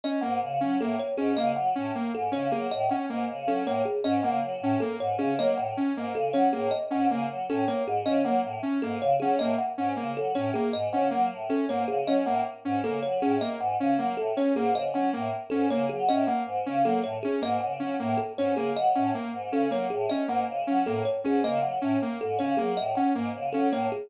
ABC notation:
X:1
M:7/8
L:1/8
Q:1/4=157
K:none
V:1 name="Choir Aahs" clef=bass
z _A,, _D, _G, =A,, z _A,, | _D, _G, A,, z _A,, D, G, | A,, z _A,, _D, _G, =A,, z | _A,, _D, _G, =A,, z _A,, D, |
_G, A,, z _A,, _D, G, =A,, | z _A,, _D, _G, =A,, z _A,, | _D, _G, A,, z _A,, D, G, | A,, z _A,, _D, _G, =A,, z |
_A,, _D, _G, =A,, z _A,, D, | _G, A,, z _A,, _D, G, =A,, | z _A,, _D, _G, =A,, z _A,, | _D, _G, A,, z _A,, D, G, |
A,, z _A,, _D, _G, =A,, z | _A,, _D, _G, =A,, z _A,, D, | _G, A,, z _A,, _D, G, =A,, | z _A,, _D, _G, =A,, z _A,, |
_D, _G, A,, z _A,, D, G, | A,, z _A,, _D, _G, =A,, z |]
V:2 name="Lead 2 (sawtooth)"
_D _B, z D B, z D | _B, z _D B, z D B, | z _D _B, z D B, z | _D _B, z D B, z D |
_B, z _D B, z D B, | z _D _B, z D B, z | _D _B, z D B, z D | _B, z _D B, z D B, |
z _D _B, z D B, z | _D _B, z D B, z D | _B, z _D B, z D B, | z _D _B, z D B, z |
_D _B, z D B, z D | _B, z _D B, z D B, | z _D _B, z D B, z | _D _B, z D B, z D |
_B, z _D B, z D B, | z _D _B, z D B, z |]
V:3 name="Kalimba"
_e _g z2 A _d _A | _e _g z2 A _d _A | _e _g z2 A _d _A | _e _g z2 A _d _A |
_e _g z2 A _d _A | _e _g z2 A _d _A | _e _g z2 A _d _A | _e _g z2 A _d _A |
_e _g z2 A _d _A | _e _g z2 A _d _A | _e _g z2 A _d _A | _e _g z2 A _d _A |
_e _g z2 A _d _A | _e _g z2 A _d _A | _e _g z2 A _d _A | _e _g z2 A _d _A |
_e _g z2 A _d _A | _e _g z2 A _d _A |]